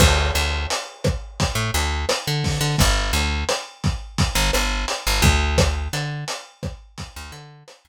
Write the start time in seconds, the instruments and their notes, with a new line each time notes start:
0.00 electric bass (finger) D2, kick, cross-stick, crash
0.35 electric bass (finger) D2, closed hi-hat
0.70 closed hi-hat
1.04 kick, cross-stick, closed hi-hat
1.40 kick, closed hi-hat
1.55 electric bass (finger) A2
1.74 electric bass (finger) D2, closed hi-hat
2.09 cross-stick, closed hi-hat
2.27 electric bass (finger) D3
2.44 kick, open hi-hat
2.61 electric bass (finger) D3
2.78 electric bass (finger) G1, kick, closed hi-hat
3.13 electric bass (finger) D2, closed hi-hat
3.49 cross-stick, closed hi-hat
3.84 kick, closed hi-hat
4.18 kick, closed hi-hat
4.35 electric bass (finger) G1
4.53 electric bass (finger) G1, cross-stick, closed hi-hat
4.88 closed hi-hat
5.07 electric bass (finger) G1
5.22 electric bass (finger) D2, kick, closed hi-hat
5.58 kick, cross-stick, closed hi-hat
5.93 electric bass (finger) D3, closed hi-hat
6.28 closed hi-hat
6.63 kick, cross-stick, closed hi-hat
6.98 kick, closed hi-hat
7.16 electric bass (finger) D2
7.32 electric bass (finger) D3, closed hi-hat
7.68 cross-stick, closed hi-hat
7.85 electric bass (finger) D2